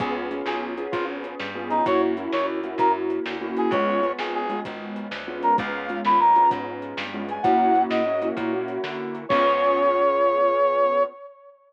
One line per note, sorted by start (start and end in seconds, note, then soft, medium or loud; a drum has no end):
0.00 0.42 C#2 medium
0.00 0.29 B3 medium
0.00 0.29 C#4 medium
0.00 0.29 F4 medium
0.00 0.14 G#4 medium
0.00 0.29 G#4 loud
0.00 kick loud
0.00 closed hi-hat loud
0.31 0.74 B3 medium
0.31 0.74 C#4 medium
0.31 0.74 F4 medium
0.31 0.74 G#4 medium
0.31 closed hi-hat medium
0.46 0.88 B1 medium
0.46 0.61 G#4 medium
0.46 snare loud
0.78 1.49 B3 medium
0.78 1.49 C#4 medium
0.78 1.49 F4 medium
0.78 1.49 G#4 medium
0.78 closed hi-hat medium
0.92 1.35 G#1 medium
0.92 1.05 F4 medium
0.92 kick loud
0.92 closed hi-hat loud
1.24 closed hi-hat medium
1.40 1.82 G2 medium
1.40 snare loud
1.55 1.83 B3 medium
1.55 1.83 C#4 medium
1.55 1.83 F4 medium
1.55 1.83 G#4 medium
1.70 1.85 D#4 medium
1.70 closed hi-hat medium
1.86 2.28 F#2 medium
1.86 2.14 A#3 medium
1.86 2.14 C#4 medium
1.86 2.14 E4 medium
1.86 2.14 F#4 medium
1.86 2.02 C#5 medium
1.86 kick loud
1.86 closed hi-hat loud
2.17 2.60 A#3 medium
2.17 2.60 C#4 medium
2.17 2.60 E4 medium
2.17 2.60 F#4 medium
2.17 closed hi-hat medium
2.32 2.75 D#2 medium
2.32 2.46 C#5 medium
2.32 snare loud
2.64 3.35 A#3 medium
2.64 3.35 C#4 medium
2.64 3.35 E4 medium
2.64 3.35 F#4 medium
2.64 closed hi-hat medium
2.78 3.20 F#2 medium
2.78 2.92 A#4 medium
2.78 kick medium
2.78 closed hi-hat loud
3.10 closed hi-hat medium
3.26 3.68 D2 medium
3.26 snare loud
3.41 3.70 A#3 medium
3.41 3.70 C#4 medium
3.41 3.70 E4 medium
3.41 3.70 F#4 medium
3.57 3.72 G#4 medium
3.57 closed hi-hat medium
3.71 4.13 C#2 medium
3.71 4.01 G#3 medium
3.71 4.01 B3 medium
3.71 4.01 C#4 medium
3.71 4.01 F4 medium
3.71 4.12 C#5 medium
3.71 kick loud
3.71 closed hi-hat loud
4.03 4.46 G#3 medium
4.03 4.46 B3 medium
4.03 4.46 C#4 medium
4.03 4.46 F4 medium
4.03 closed hi-hat medium
4.19 4.61 G#1 medium
4.19 4.34 G#4 medium
4.19 snare loud
4.35 4.60 G#4 medium
4.49 5.21 G#3 medium
4.49 5.21 B3 medium
4.49 5.21 C#4 medium
4.49 5.21 F4 medium
4.49 closed hi-hat medium
4.65 5.08 G#1 medium
4.65 kick medium
4.65 closed hi-hat loud
4.96 closed hi-hat medium
5.11 5.53 D2 medium
5.11 snare loud
5.27 5.56 G#3 medium
5.27 5.56 B3 medium
5.27 5.56 C#4 medium
5.27 5.56 F4 medium
5.43 5.56 A#4 medium
5.43 closed hi-hat medium
5.58 6.01 C#2 medium
5.58 5.87 G#3 medium
5.58 5.87 B3 medium
5.58 5.87 C#4 medium
5.58 5.87 F4 medium
5.58 6.00 F5 medium
5.58 kick loud
5.58 closed hi-hat loud
5.89 6.32 G#3 medium
5.89 6.32 B3 medium
5.89 6.32 C#4 medium
5.89 6.32 F4 medium
5.89 closed hi-hat medium
6.05 6.47 D#2 medium
6.05 6.19 B5 medium
6.05 snare loud
6.20 6.49 A#5 medium
6.36 7.07 G#3 medium
6.36 7.07 B3 medium
6.36 7.07 C#4 medium
6.36 7.07 F4 medium
6.36 closed hi-hat medium
6.51 6.94 G#2 medium
6.51 kick loud
6.51 closed hi-hat loud
6.82 closed hi-hat medium
6.97 7.39 G2 medium
6.97 snare loud
7.13 7.42 G#3 medium
7.13 7.42 B3 medium
7.13 7.42 C#4 medium
7.13 7.42 F4 medium
7.29 7.44 G#5 medium
7.29 closed hi-hat medium
7.43 7.87 F#2 medium
7.43 8.01 A#3 medium
7.43 8.01 C#4 medium
7.43 8.01 E4 medium
7.43 8.01 F#4 medium
7.43 7.82 F#5 medium
7.43 kick loud
7.43 closed hi-hat loud
7.75 closed hi-hat medium
7.90 8.32 G#2 medium
7.90 8.28 D#5 medium
7.90 snare loud
8.06 8.21 A#3 medium
8.06 8.21 C#4 medium
8.06 8.21 E4 medium
8.06 8.21 F#4 medium
8.22 8.36 A#3 medium
8.22 8.36 C#4 medium
8.22 8.36 E4 medium
8.22 8.36 F#4 medium
8.22 closed hi-hat medium
8.37 8.78 A#2 medium
8.37 8.51 A#3 medium
8.37 8.51 C#4 medium
8.37 8.51 E4 medium
8.37 8.51 F#4 medium
8.37 kick loud
8.37 closed hi-hat loud
8.53 9.24 A#3 medium
8.53 9.24 C#4 medium
8.53 9.24 E4 medium
8.53 9.24 F#4 medium
8.68 closed hi-hat medium
8.84 9.26 D3 medium
8.84 snare loud
9.15 closed hi-hat medium
9.29 11.05 C#2 medium
9.29 11.04 B3 loud
9.29 11.04 C#4 loud
9.29 11.04 F4 loud
9.29 11.04 G#4 loud
9.29 11.03 C#5 loud
9.29 kick loud
9.29 crash loud